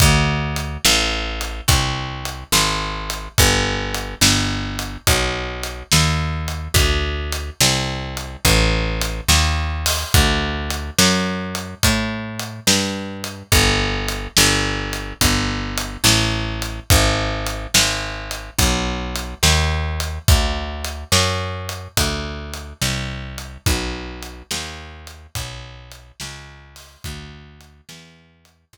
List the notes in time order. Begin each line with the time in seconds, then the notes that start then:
0.00 D2, kick, closed hi-hat
0.56 closed hi-hat
0.85 A1, snare
1.41 closed hi-hat
1.68 C2, kick, closed hi-hat
2.25 closed hi-hat
2.52 G#1, snare
3.10 closed hi-hat
3.38 G1, kick, closed hi-hat
3.94 closed hi-hat
4.21 G1, snare
4.79 closed hi-hat
5.07 B1, kick, closed hi-hat
5.63 closed hi-hat
5.92 D#2, snare
6.48 closed hi-hat
6.74 D2, kick, closed hi-hat
7.32 closed hi-hat
7.60 C2, snare
8.17 closed hi-hat
8.45 A1, kick, closed hi-hat
9.01 closed hi-hat
9.28 D#2, snare
9.86 open hi-hat
10.14 D2, kick, closed hi-hat
10.70 closed hi-hat
10.98 F#2, snare
11.55 closed hi-hat
11.83 A2, kick, closed hi-hat
12.39 closed hi-hat
12.67 G2, snare
13.24 closed hi-hat
13.52 G1, kick, closed hi-hat
14.08 closed hi-hat
14.37 G1, snare
14.93 closed hi-hat
15.21 G1, kick, closed hi-hat
15.77 closed hi-hat
16.04 A1, snare
16.62 closed hi-hat
16.90 G#1, kick, closed hi-hat
17.46 closed hi-hat
17.74 G#1, snare
18.31 closed hi-hat
18.58 B1, kick, closed hi-hat
19.15 closed hi-hat
19.43 D#2, snare
20.00 closed hi-hat
20.28 D2, kick, closed hi-hat
20.85 closed hi-hat
21.12 F#2, snare
21.69 closed hi-hat
21.97 D2, kick, closed hi-hat
22.54 closed hi-hat
22.82 C2, snare
23.38 closed hi-hat
23.66 B1, kick, closed hi-hat
24.23 closed hi-hat
24.51 D#2, snare
25.07 closed hi-hat
25.35 B1, kick, closed hi-hat
25.92 closed hi-hat
26.20 C#2, snare
26.76 open hi-hat
27.04 D2, kick, closed hi-hat
27.61 closed hi-hat
27.89 E2, snare
28.45 closed hi-hat
28.73 C2, kick, closed hi-hat